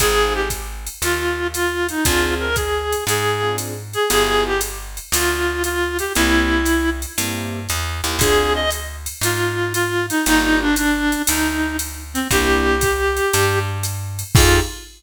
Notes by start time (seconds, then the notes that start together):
0.00 G#1 C4 D#4 F4 G#4, kick, ride
0.35 G4
0.50 kick, hi-hat pedal, ride
0.87 ride
1.02 D#2 F4, ride
1.54 F4, hi-hat pedal, ride
1.89 D#4, ride
2.05 D2 C4 D4 F4 G#4, kick, ride
2.40 A#4
2.56 G#4, kick, hi-hat pedal, ride
2.93 ride
3.07 G#2 G#4, ride
3.43 C4 D4 F4 G#4
3.58 hi-hat pedal, ride
3.93 G#4, ride
4.10 G1 B3 E4 F4 G4 G#4, ride
4.46 G4
4.61 hi-hat pedal, ride
4.97 ride
5.12 D2 F4, ride
5.64 F4, hi-hat pedal, ride
5.99 G4, ride
6.15 C2 A#3 C4 E4 G4, ride
6.65 hi-hat pedal, ride
7.02 ride
7.18 G2 A#3 C4 E4 G4, ride
7.69 E2, hi-hat pedal, ride
8.04 D#2 A#3 C4 E4 G4, ride
8.19 D2 C4 D4 F4 G#4, kick, ride
8.55 D#5
8.71 hi-hat pedal, ride
9.06 ride
9.21 G#2 F4, ride
9.73 F4, hi-hat pedal, ride
10.10 D#4, ride
10.26 G1 A#3 D4 D#4 F4 G4, ride
10.61 D4
10.76 D4, hi-hat pedal, ride
11.12 ride
11.27 D2 D#4, ride
11.79 hi-hat pedal, ride
12.14 C4, ride
12.31 C2 A#3 C4 D4 E4 G4, kick, ride
12.81 kick, hi-hat pedal, ride
13.17 ride
13.33 G2, ride
13.83 hi-hat pedal, ride
14.19 ride
14.35 F2 D#4 F4 G4 G#4, kick, crash